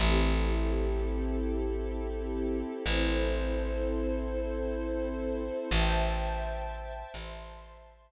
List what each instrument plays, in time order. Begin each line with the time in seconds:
0.00 electric bass (finger) A1, string ensemble 1 C4 E4 G4 A4
2.86 electric bass (finger) A1, string ensemble 1 C4 E4 A4 C5
5.71 electric bass (finger) A1, string ensemble 1 C5 E5 G5 A5
7.14 electric bass (finger) A1, string ensemble 1 C5 E5 A5 C6